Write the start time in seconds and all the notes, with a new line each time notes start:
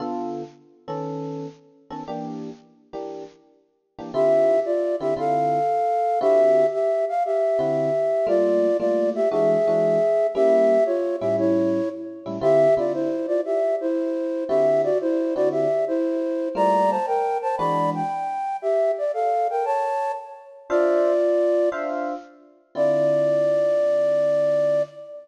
0.00 D3 B3 F4 A4
0.88 D#3 B3 C#4 A4
1.90 D#3 B3 C#4 A4
2.08 E3 A#3 D4 G4
2.93 E3 A#3 D4 G4
3.98 E3 A#3 D4 G4
4.14 D3 C4 E4 F4 G4 E5
4.65 F4 D5
5.00 D3 C4 E4 F4 G4 E5
5.16 D3 C4 E4 F4 A4 F5
6.21 D3 C4 E4 F#4 G4 E5
6.73 G4 E5
7.09 F5
7.25 G4 E5
7.59 D3 C4 E4 F#4
8.27 G3 A3 A#3 F4 D5
8.80 G3 A3 A#3 F4 D5
9.15 G4 E5
9.31 E3 G#3 D4 F#4 G#4 E5
9.67 E3 G#3 D4 F#4
10.35 G3 A#3 C#4 E4 G4 E5
10.86 F4 C#5
11.20 A2 G3 C#4 E4 G4 E5
11.38 E4 C#5
12.26 A2 G3 C#4 E4
12.41 D3 C4 E4 F4 G4 E5
12.77 D3 C4 E4 F4 D5
12.94 E4 C5
13.27 F4 D5
13.45 G4 E5
13.81 E4 C5
14.48 D3 C4 E4 F#4 G4 E5
14.84 F#4 D5
15.01 E4 C5
15.35 D3 C4 E4 F#4 D5
15.52 G4 E5
15.88 E4 C5
16.55 G3 A3 A#3 F4 D5 A#5
16.90 C5 A5
17.07 A#4 G5
17.42 C5 A5
17.57 E3 G#3 D4 F#4 D5 B5
17.95 G5
18.62 G4 E5
18.98 D5
19.14 A4 F5
19.50 A#4 G5
19.65 C#5 A5
20.69 D4 F4 C5 D5 E5 F5
21.72 D4 C5 E5 F5
22.75 D3 C4 E4 F4 D5